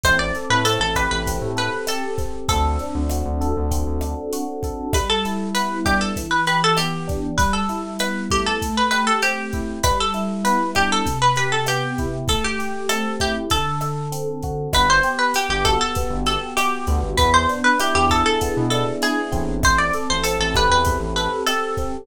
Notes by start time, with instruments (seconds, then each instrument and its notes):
0.03 synth bass 1 A1, electric piano 1 C4, acoustic guitar (steel) C5, kick, cross-stick, closed hi-hat
0.19 acoustic guitar (steel) D5
0.35 electric piano 1 A4, closed hi-hat
0.50 synth bass 1 A2, acoustic guitar (steel) B4
0.65 electric piano 1 C4, acoustic guitar (steel) A4, closed hi-hat
0.80 synth bass 1 A1, acoustic guitar (steel) A4
0.95 electric piano 1 G4, acoustic guitar (steel) B4, kick, cross-stick, closed hi-hat
1.11 synth bass 1 A1, acoustic guitar (steel) B4
1.27 electric piano 1 C4, kick, closed hi-hat
1.41 synth bass 1 A2
1.56 electric piano 1 A4, acoustic guitar (steel) B4, closed hi-hat
1.87 electric piano 1 G4, acoustic guitar (steel) A4, cross-stick, closed hi-hat
2.18 electric piano 1 C4, kick, closed hi-hat
2.48 synth bass 1 D2, electric piano 1 C4, acoustic guitar (steel) A4, kick, closed hi-hat
2.79 electric piano 1 D4, closed hi-hat
2.95 synth bass 1 D2
3.09 electric piano 1 F#4, cross-stick, closed hi-hat
3.25 synth bass 1 D2
3.41 electric piano 1 A4, closed hi-hat
3.57 synth bass 1 D2
3.71 electric piano 1 C4, kick, closed hi-hat
3.87 synth bass 1 D2
4.01 electric piano 1 D4, cross-stick, closed hi-hat
4.33 electric piano 1 F#4, closed hi-hat
4.63 electric piano 1 A4, kick, closed hi-hat
4.93 electric piano 1 G3, acoustic guitar (steel) B4, kick, cross-stick, closed hi-hat
5.09 acoustic guitar (steel) A4
5.25 electric piano 1 E4, closed hi-hat
5.54 electric piano 1 B3, acoustic guitar (steel) B4, closed hi-hat
5.85 electric piano 1 D4, acoustic guitar (steel) G4, kick, cross-stick, closed hi-hat
6.01 acoustic guitar (steel) A4
6.16 electric piano 1 E3, kick, closed hi-hat
6.31 acoustic guitar (steel) B4
6.47 electric piano 1 G4, acoustic guitar (steel) B4, closed hi-hat
6.64 acoustic guitar (steel) A4
6.77 electric piano 1 B3, acoustic guitar (steel) G4, cross-stick, closed hi-hat
7.07 electric piano 1 D4, kick, closed hi-hat
7.38 electric piano 1 G3, acoustic guitar (steel) B4, kick, closed hi-hat
7.53 acoustic guitar (steel) A4
7.69 electric piano 1 E4, closed hi-hat
7.99 electric piano 1 B3, acoustic guitar (steel) B4, cross-stick, closed hi-hat
8.30 electric piano 1 A3, acoustic guitar (steel) G4, kick, closed hi-hat
8.46 acoustic guitar (steel) A4
8.62 kick, closed hi-hat
8.77 acoustic guitar (steel) B4
8.91 electric piano 1 G4, acoustic guitar (steel) B4, cross-stick, closed hi-hat
9.07 acoustic guitar (steel) A4
9.22 electric piano 1 C4, acoustic guitar (steel) G4, closed hi-hat
9.53 electric piano 1 E4, kick, closed hi-hat
9.83 electric piano 1 G3, acoustic guitar (steel) B4, kick, cross-stick, closed hi-hat
10.00 acoustic guitar (steel) A4
10.14 electric piano 1 E4, closed hi-hat
10.44 electric piano 1 B3, acoustic guitar (steel) B4, closed hi-hat
10.75 electric piano 1 D4, acoustic guitar (steel) G4, kick, cross-stick, closed hi-hat
10.92 acoustic guitar (steel) A4
11.05 electric piano 1 C3, kick, closed hi-hat
11.22 acoustic guitar (steel) B4
11.36 electric piano 1 G4, acoustic guitar (steel) B4, closed hi-hat
11.52 acoustic guitar (steel) A4
11.66 electric piano 1 B3, acoustic guitar (steel) G4, cross-stick, closed hi-hat
11.98 electric piano 1 E4, kick, closed hi-hat
12.28 electric piano 1 A3, acoustic guitar (steel) A4, kick, closed hi-hat
12.44 acoustic guitar (steel) G4
12.59 electric piano 1 G4, closed hi-hat
12.89 electric piano 1 C4, acoustic guitar (steel) A4, cross-stick, closed hi-hat
13.20 electric piano 1 E4, acoustic guitar (steel) G4, kick, closed hi-hat
13.50 electric piano 1 D3, acoustic guitar (steel) A4, kick, closed hi-hat
13.81 electric piano 1 A4, cross-stick, closed hi-hat
14.12 electric piano 1 C4, closed hi-hat
14.42 electric piano 1 F#4, kick, closed hi-hat
14.73 synth bass 1 G1, electric piano 1 B3, acoustic guitar (steel) B4, kick, cross-stick, closed hi-hat
14.90 acoustic guitar (steel) C5
15.03 electric piano 1 G4, closed hi-hat
15.18 acoustic guitar (steel) B4
15.34 electric piano 1 B3, acoustic guitar (steel) G4, closed hi-hat
15.49 synth bass 1 G1, acoustic guitar (steel) G4
15.65 electric piano 1 F#4, acoustic guitar (steel) A4, kick, cross-stick, closed hi-hat
15.80 acoustic guitar (steel) A4
15.95 electric piano 1 B3, kick, closed hi-hat
16.10 synth bass 1 G1
16.26 electric piano 1 G4, acoustic guitar (steel) A4, closed hi-hat
16.57 electric piano 1 F#4, acoustic guitar (steel) G4, cross-stick, closed hi-hat
16.87 synth bass 1 D2, electric piano 1 B3, kick, closed hi-hat
17.03 synth bass 1 G1
17.17 synth bass 1 E2, electric piano 1 B3, acoustic guitar (steel) B4, kick, closed hi-hat
17.34 acoustic guitar (steel) C5
17.48 electric piano 1 D4, closed hi-hat
17.64 acoustic guitar (steel) B4
17.79 electric piano 1 E4, acoustic guitar (steel) G4, cross-stick, closed hi-hat
17.95 synth bass 1 E2, acoustic guitar (steel) G4
18.10 electric piano 1 G#4, acoustic guitar (steel) A4, kick, closed hi-hat
18.26 acoustic guitar (steel) A4
18.41 electric piano 1 B3, kick, closed hi-hat
18.57 synth bass 1 B2
18.70 electric piano 1 D4, acoustic guitar (steel) A4, cross-stick, closed hi-hat
19.01 electric piano 1 E4, acoustic guitar (steel) G#4, closed hi-hat
19.32 synth bass 1 A1, electric piano 1 C4, kick, closed hi-hat
19.63 acoustic guitar (steel) C5, kick, cross-stick, closed hi-hat
19.78 acoustic guitar (steel) D5
19.93 electric piano 1 A4, closed hi-hat
20.10 synth bass 1 A1, acoustic guitar (steel) C5
20.23 electric piano 1 C4, acoustic guitar (steel) A4, closed hi-hat
20.39 synth bass 1 A1, acoustic guitar (steel) A4
20.54 electric piano 1 G4, acoustic guitar (steel) B4, kick, cross-stick, closed hi-hat
20.69 synth bass 1 E2, acoustic guitar (steel) B4
20.85 electric piano 1 C4, kick, closed hi-hat
21.00 synth bass 1 A1
21.16 electric piano 1 A4, acoustic guitar (steel) B4, closed hi-hat
21.46 electric piano 1 G4, acoustic guitar (steel) A4, cross-stick, closed hi-hat
21.77 electric piano 1 C4, kick, closed hi-hat